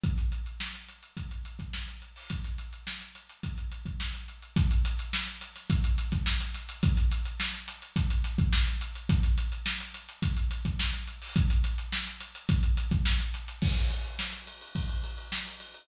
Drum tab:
CC |----------------|----------------|----------------|----------------|
RD |----------------|----------------|----------------|----------------|
HH |xxxx-xxxxxxx-xxo|xxxx-xxxxxxx-xxx|xxxx-xxxxxxx-xxx|xxxx-xxxxxxx-xxx|
SD |-o--o-------o---|-o--o-------o---|----o--o----o-o-|-o--o-----o-oo--|
BD |o-------o--o----|o-------o--o----|o-------o--o----|o-------o--o----|

CC |----------------|----------------|x---------------|
RD |----------------|----------------|-xxx-xxxxxxx-xxx|
HH |xxxx-xxxxxxx-xxo|xxxx-xxxxxxx-xxx|----------------|
SD |-o--o-------o---|-o--o-------o---|-o--o-------o---|
BD |o-------o--o----|o-------o--o----|o-------o-------|